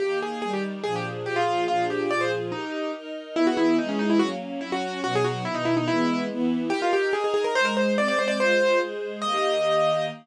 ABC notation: X:1
M:2/4
L:1/16
Q:1/4=143
K:Eb
V:1 name="Acoustic Grand Piano"
G2 A2 A G z2 | A G z2 G F3 | F2 G2 d c z2 | E4 z4 |
[K:E] E F E2 D C D E | F z3 E F3 | F G F2 E D E D | E4 z4 |
[K:Eb] G F G2 A A A B | c B c2 d d c d | c4 z4 | e8 |]
V:2 name="String Ensemble 1"
[E,B,G]4 [E,G,G]4 | [B,,F,DA]4 [B,,F,FA]4 | [B,,F,DA]4 [B,,F,FA]4 | [EGB]4 [EBe]4 |
[K:E] [E,B,G]4 [E,G,G]4 | [F,^A,C]4 [F,CF]4 | [B,,F,D]4 [B,,D,D]4 | [E,G,B,]4 [E,B,E]4 |
[K:Eb] [EGB]4 [EBe]4 | [A,Ec]4 [A,Cc]4 | [A,Fc]4 [A,Ac]4 | [E,B,G]8 |]